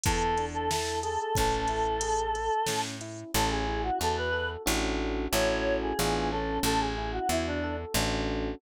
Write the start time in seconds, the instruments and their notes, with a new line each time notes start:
0.04 electric bass (finger) E2, electric piano 1 B3, choir aahs A4, kick, closed hi-hat
0.38 electric piano 1 D4, closed hi-hat
0.54 choir aahs A4
0.70 electric piano 1 E4, choir aahs A4, snare
1.03 electric piano 1 G#4, choir aahs A4, closed hi-hat
1.20 choir aahs A4
1.35 electric bass (finger) A1, electric piano 1 C#4, choir aahs A4, kick, closed hi-hat
1.68 electric piano 1 E4, closed hi-hat
2.01 electric piano 1 G#4, closed hi-hat
2.35 electric piano 1 A4, closed hi-hat
2.66 electric bass (finger) A2, electric piano 1 C#4, snare
3.01 electric piano 1 E4, closed hi-hat
3.34 electric bass (finger) A1, electric piano 1 C#4, choir aahs A4
3.51 choir aahs G#4
3.68 electric piano 1 E4
3.83 choir aahs F#4
3.99 electric bass (finger) E2, electric piano 1 F#4, choir aahs A4
4.17 choir aahs B4
4.33 electric piano 1 A4
4.66 electric bass (finger) A1, electric piano 1 C#4 D4 F#4 A4
5.32 electric bass (finger) A1, electric piano 1 C#4 E4 F#4 A4, choir aahs C#5
5.82 choir aahs G#4
5.99 electric bass (finger) A1, electric piano 1 B3 D4 F4 G#4
6.31 electric piano 1 C#4, choir aahs A4
6.63 electric bass (finger) A1, choir aahs A4
6.80 choir aahs G#4
6.98 electric piano 1 E4
7.13 choir aahs F#4
7.29 electric bass (finger) E2, choir aahs E4, electric piano 1 F#4
7.46 choir aahs D4
7.64 electric piano 1 A4
7.94 electric bass (finger) A1, electric piano 1 C#4 D4 F#4 A4